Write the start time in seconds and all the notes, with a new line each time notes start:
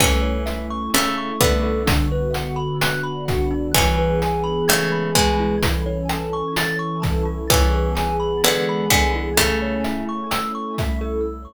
0.00 E3 A3 C#4 E4 A4, kick, cross-stick, closed hi-hat
0.22 C#5
0.46 E4 E5, closed hi-hat
0.70 C#6
0.93 C#3 A3 C#4 E4 A4 E6, closed hi-hat
1.18 C#6
1.40 D3 B3 E4 E5, kick, closed hi-hat
1.63 A4
1.86 D3 B3 D4 F#4, kick, closed hi-hat
2.12 B4
2.33 F#4 F#5, closed hi-hat
2.56 B5
2.80 D3 B3 D4 F#4 F#6, cross-stick, closed hi-hat
3.04 B5
3.28 F#4 F#5, kick, closed hi-hat
3.51 D4
3.74 E3 B3 C#4 E4 G#4, kick, closed hi-hat
3.98 B4
4.22 G#4 G#5, closed hi-hat
4.44 B5
4.68 C#3 E3 G#3 A3 B3 G#4 G#6, cross-stick, closed hi-hat
4.92 B5
5.15 B2 G#3 G#4 G#5, kick, closed hi-hat
5.40 E4
5.61 E3 C#4 E4 A4, kick, closed hi-hat
5.86 C#5
6.09 A4 A5, cross-stick, closed hi-hat
6.33 C#6
6.56 E3 C#4 E4 A4 A6, closed hi-hat
6.79 C#6
7.02 A4 A5, kick, closed hi-hat
7.25 E4
7.50 E3 B3 C#4 E4 G#4, kick, cross-stick, closed hi-hat
7.74 B4
7.95 G#4 G#5, closed hi-hat
8.20 B5
8.43 D3 E3 G#3 B3 G#4 G#6, closed hi-hat
8.69 B5
8.90 D3 B3 G#4 G#5, kick, cross-stick, closed hi-hat
9.15 E4
9.37 C#3 A3 C#4 E4 A4, kick, closed hi-hat
9.62 C#5
9.84 E4 E5, closed hi-hat
10.09 C#6
10.31 A3 C#4 E4 A4 E6, cross-stick, closed hi-hat
10.55 C#6
10.78 E4 E5, kick, closed hi-hat
11.01 A4